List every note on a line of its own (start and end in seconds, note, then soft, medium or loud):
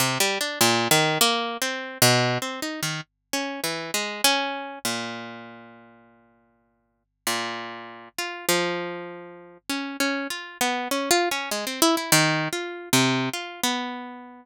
0.00 0.18 C3 medium
0.20 0.38 G3 medium
0.41 0.59 D4 medium
0.61 0.88 A#2 loud
0.91 1.18 D#3 loud
1.21 1.57 A#3 loud
1.62 1.98 C4 medium
2.02 2.38 B2 loud
2.42 2.60 C4 medium
2.62 2.81 D#4 medium
2.83 3.01 D#3 medium
3.33 3.60 C#4 medium
3.64 3.91 E3 medium
3.94 4.21 G#3 medium
4.24 4.79 C#4 loud
4.85 7.03 A#2 medium
7.27 8.09 A#2 medium
8.18 8.46 F4 medium
8.49 9.58 F3 medium
9.69 9.97 C#4 medium
10.00 10.27 C#4 medium
10.30 10.58 F4 medium
10.61 10.88 B3 medium
10.91 11.09 C#4 medium
11.11 11.29 F4 loud
11.31 11.50 C#4 medium
11.51 11.65 G#3 medium
11.67 11.80 C4 medium
11.82 11.96 E4 loud
11.97 12.11 E4 medium
12.12 12.48 D#3 loud
12.53 12.89 F4 medium
12.93 13.29 C3 medium
13.33 13.61 F4 medium
13.63 14.45 B3 medium